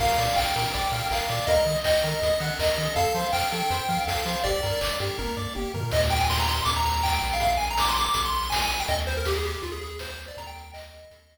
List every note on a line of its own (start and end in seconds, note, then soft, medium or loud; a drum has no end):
0.00 0.10 A#1 medium
0.00 0.17 A#4 medium
0.00 0.34 F5 loud
0.00 kick loud
0.00 crash loud
0.18 0.28 A#2 medium
0.18 0.35 D5 medium
0.18 open hi-hat medium
0.36 0.47 A#1 medium
0.36 0.54 F5 medium
0.36 1.08 G5 medium
0.36 kick loud
0.36 clap loud
0.56 0.66 A#2 medium
0.56 0.72 A#4 medium
0.56 open hi-hat medium
0.74 0.85 A#1 medium
0.74 0.91 D5 medium
0.74 kick medium
0.74 closed hi-hat loud
0.91 1.02 A#2 medium
0.91 1.09 F5 medium
0.91 open hi-hat medium
1.11 1.21 A#1 medium
1.11 1.28 A#4 medium
1.11 1.49 F5 medium
1.11 kick medium
1.11 clap loud
1.29 1.40 A#2 medium
1.29 1.46 D5 medium
1.29 open hi-hat medium
1.47 1.58 D#2 loud
1.47 1.65 A#4 medium
1.47 1.78 D#5 medium
1.47 kick loud
1.47 closed hi-hat loud
1.66 1.76 D#3 medium
1.66 1.83 D#5 soft
1.66 open hi-hat medium
1.84 1.95 D#2 medium
1.84 2.47 D#5 medium
1.84 2.02 G5 medium
1.84 kick medium
1.84 clap loud
2.04 2.14 D#3 loud
2.04 2.20 A#4 medium
2.04 open hi-hat medium
2.22 2.32 D#2 medium
2.22 2.39 D#5 medium
2.22 kick medium
2.22 closed hi-hat loud
2.40 2.51 D#3 loud
2.40 2.58 F#5 medium
2.40 open hi-hat medium
2.59 2.69 D#2 medium
2.59 2.76 A#4 medium
2.59 2.93 D#5 medium
2.59 kick medium
2.59 clap loud
2.78 2.88 D#3 medium
2.78 2.95 D#5 medium
2.78 open hi-hat medium
2.95 3.07 F2 loud
2.95 3.13 A4 medium
2.95 3.27 F5 loud
2.95 kick loud
2.95 closed hi-hat loud
3.14 3.25 F3 medium
3.14 3.31 C5 medium
3.14 open hi-hat medium
3.32 3.44 F2 medium
3.32 3.50 F5 medium
3.32 4.00 G5 medium
3.32 kick medium
3.32 clap loud
3.52 3.63 F3 medium
3.52 3.69 A4 medium
3.52 open hi-hat medium
3.70 3.81 F2 loud
3.70 3.87 C5 medium
3.70 closed hi-hat loud
3.89 3.99 F3 loud
3.89 4.06 F5 medium
3.89 kick medium
3.89 open hi-hat medium
4.07 4.18 F2 medium
4.07 4.24 A4 medium
4.07 4.39 F5 medium
4.07 kick medium
4.07 snare loud
4.25 4.36 F3 medium
4.25 4.43 C5 medium
4.25 open hi-hat medium
4.44 4.55 G1 medium
4.44 4.61 G4 medium
4.44 4.93 D5 loud
4.44 kick loud
4.44 closed hi-hat loud
4.63 4.74 G2 loud
4.63 4.80 A#4 medium
4.63 open hi-hat medium
4.81 4.92 G1 medium
4.81 4.98 D5 medium
4.81 kick medium
4.81 clap loud
4.99 5.10 G2 medium
4.99 5.17 G4 medium
4.99 open hi-hat medium
5.18 5.29 G1 medium
5.18 5.35 A#4 medium
5.18 kick medium
5.18 high tom medium
5.37 5.47 G2 medium
5.37 5.54 D5 medium
5.55 5.66 G1 medium
5.55 5.72 G4 medium
5.55 high tom medium
5.74 5.84 G2 medium
5.74 5.91 A#4 medium
5.74 floor tom loud
5.91 6.61 D#2 loud
5.91 6.01 D#5 loud
5.91 kick loud
5.91 crash loud
6.02 closed hi-hat medium
6.10 6.19 G5 medium
6.10 open hi-hat medium
6.20 6.28 G#5 medium
6.20 closed hi-hat medium
6.30 6.39 C6 loud
6.30 kick medium
6.30 snare loud
6.40 6.48 A#5 medium
6.40 closed hi-hat medium
6.49 6.64 C6 medium
6.49 open hi-hat medium
6.59 closed hi-hat medium
6.65 7.19 D#2 loud
6.65 6.74 D6 medium
6.65 kick medium
6.65 closed hi-hat loud
6.75 6.85 A#5 medium
6.75 closed hi-hat medium
6.84 7.02 A#5 medium
6.84 open hi-hat medium
6.96 closed hi-hat medium
7.03 7.12 G5 medium
7.03 kick loud
7.03 clap loud
7.13 7.31 G5 medium
7.13 closed hi-hat medium
7.22 8.09 A#1 medium
7.22 open hi-hat medium
7.31 7.42 F5 medium
7.31 open hi-hat medium
7.40 7.51 F5 medium
7.40 kick loud
7.40 closed hi-hat loud
7.51 closed hi-hat medium
7.57 7.66 G#5 medium
7.57 open hi-hat medium
7.69 7.79 A#5 medium
7.69 closed hi-hat medium
7.78 7.88 D6 medium
7.78 kick medium
7.78 snare loud
7.88 7.97 C6 medium
7.88 closed hi-hat medium
7.97 8.13 D6 medium
7.97 open hi-hat medium
8.05 closed hi-hat medium
8.14 8.83 A#1 medium
8.14 8.22 D6 medium
8.14 kick medium
8.14 closed hi-hat loud
8.24 8.34 C6 medium
8.24 closed hi-hat medium
8.33 8.50 C6 medium
8.33 open hi-hat medium
8.43 closed hi-hat medium
8.50 8.59 G#5 medium
8.50 kick medium
8.50 snare loud
8.61 8.79 G#5 medium
8.61 closed hi-hat medium
8.70 open hi-hat medium
8.80 8.88 G5 medium
8.80 closed hi-hat medium
8.88 9.57 D#2 loud
8.88 8.97 D#5 medium
8.88 kick loud
8.88 closed hi-hat loud
8.99 closed hi-hat medium
9.07 9.16 C5 medium
9.07 open hi-hat medium
9.17 9.26 A#4 medium
9.17 closed hi-hat medium
9.25 9.35 G4 medium
9.25 kick loud
9.25 snare loud
9.36 9.45 G#4 medium
9.44 9.63 G4 medium
9.44 open hi-hat medium
9.54 closed hi-hat medium
9.62 10.31 D#2 medium
9.62 9.71 F4 medium
9.62 kick medium
9.62 closed hi-hat medium
9.72 9.81 G#4 medium
9.72 closed hi-hat medium
9.81 9.99 G#4 medium
9.81 open hi-hat medium
9.91 closed hi-hat medium
9.99 10.09 C5 medium
9.99 kick medium
9.99 snare loud
10.09 10.26 C5 medium
10.09 closed hi-hat medium
10.19 open hi-hat medium
10.28 10.37 D5 medium
10.28 closed hi-hat medium
10.37 11.05 D#2 loud
10.37 10.47 A#5 medium
10.37 kick loud
10.37 closed hi-hat loud
10.47 10.72 G5 medium
10.47 closed hi-hat medium
10.55 open hi-hat medium
10.63 closed hi-hat medium
10.73 11.38 D#5 medium
10.73 kick medium
10.73 clap loud
10.83 closed hi-hat medium
10.91 open hi-hat medium
11.03 closed hi-hat medium
11.10 11.38 D#2 medium
11.10 kick medium
11.10 closed hi-hat loud
11.19 closed hi-hat medium
11.30 open hi-hat medium